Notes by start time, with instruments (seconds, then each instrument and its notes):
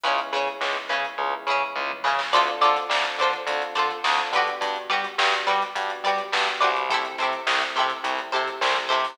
0.03 electric bass (finger) C#2, electric piano 1 G#3 B3 C#4 E4, pizzicato strings C#4 E4 G#4 B4, kick, closed hi-hat
0.18 closed hi-hat
0.33 electric bass (finger) C#3, pizzicato strings C#4 E4 G#4 B4, closed hi-hat
0.47 closed hi-hat
0.61 electric bass (finger) C#2, electric piano 1 G#3 B3 C#4 E4, snare
0.76 closed hi-hat
0.89 electric bass (finger) C#3, pizzicato strings C#4 E4 G#4 B4, snare, closed hi-hat
1.05 closed hi-hat
1.18 electric bass (finger) C#2, electric piano 1 G#3 B3 C#4 E4, kick, floor tom
1.33 floor tom
1.47 electric bass (finger) C#3, pizzicato strings E4 G#4 B4, mid tom
1.51 pizzicato strings C#4
1.61 mid tom
1.76 electric bass (finger) C#2, electric piano 1 G#3 B3 C#4 E4, high tom
1.90 high tom
2.04 electric bass (finger) C#3, pizzicato strings C#4 E4 G#4 B4, snare
2.19 snare
2.33 electric bass (finger) D2, electric piano 1 C4 D4 F4 A4, pizzicato strings F4 A4 C5 D5, kick, closed hi-hat
2.47 closed hi-hat
2.61 electric bass (finger) D3, pizzicato strings F4 A4 C5 D5, closed hi-hat
2.76 snare, closed hi-hat
2.90 electric bass (finger) D2, electric piano 1 C4 D4 F4 A4, snare
3.04 closed hi-hat
3.18 electric bass (finger) D3, pizzicato strings A4 C5 D5, closed hi-hat
3.23 pizzicato strings F4
3.33 closed hi-hat
3.47 electric bass (finger) D2, electric piano 1 C4 D4 F4 A4, kick, closed hi-hat
3.62 closed hi-hat
3.75 electric bass (finger) D3, pizzicato strings F4 A4 C5 D5, closed hi-hat
3.91 closed hi-hat
4.04 electric bass (finger) D2, electric piano 1 C4 D4 F4 A4, snare
4.18 kick, closed hi-hat
4.32 electric bass (finger) D3, electric piano 1 B3 D4 F#4 G4, pizzicato strings G4 B4 D5, closed hi-hat
4.37 pizzicato strings F#4
4.47 closed hi-hat
4.61 electric bass (finger) G2, kick, closed hi-hat
4.76 closed hi-hat
4.90 electric bass (finger) G3, pizzicato strings F#4 G4 B4 D5, closed hi-hat
5.04 closed hi-hat
5.18 electric bass (finger) G2, electric piano 1 B3 D4 F#4 G4, snare
5.33 closed hi-hat
5.47 electric bass (finger) G3, pizzicato strings F#4 G4 B4 D5, closed hi-hat
5.62 closed hi-hat
5.75 electric bass (finger) G2, electric piano 1 B3 D4 F#4 G4, kick, closed hi-hat
5.90 closed hi-hat
6.04 electric bass (finger) G3, pizzicato strings G4 B4 D5, closed hi-hat
6.08 pizzicato strings F#4
6.18 closed hi-hat
6.32 electric bass (finger) G2, electric piano 1 B3 D4 F#4 G4, snare
6.48 closed hi-hat
6.61 electric bass (finger) C2, pizzicato strings F#4 G4 B4 D5, closed hi-hat
6.76 closed hi-hat
6.89 electric piano 1 A3 C4 E4 G4, pizzicato strings G4 A4 C5, kick, closed hi-hat
6.94 pizzicato strings E4
7.05 closed hi-hat
7.18 electric bass (finger) C3, pizzicato strings A4 C5, closed hi-hat
7.22 pizzicato strings E4 G4
7.33 closed hi-hat
7.47 electric bass (finger) C2, electric piano 1 A3 C4 E4 G4, snare
7.61 snare, closed hi-hat
7.76 electric bass (finger) C3, pizzicato strings G4 A4 C5, closed hi-hat
7.80 pizzicato strings E4
7.90 closed hi-hat
8.03 electric bass (finger) C2, electric piano 1 A3 C4 E4 G4, kick, closed hi-hat
8.19 closed hi-hat
8.32 electric bass (finger) C3, pizzicato strings E4 G4 A4 C5, closed hi-hat
8.48 closed hi-hat
8.61 electric bass (finger) C2, electric piano 1 A3 C4 E4 G4, snare
8.75 kick, closed hi-hat
8.89 electric bass (finger) C3, pizzicato strings E4 G4 A4 C5, closed hi-hat
9.04 open hi-hat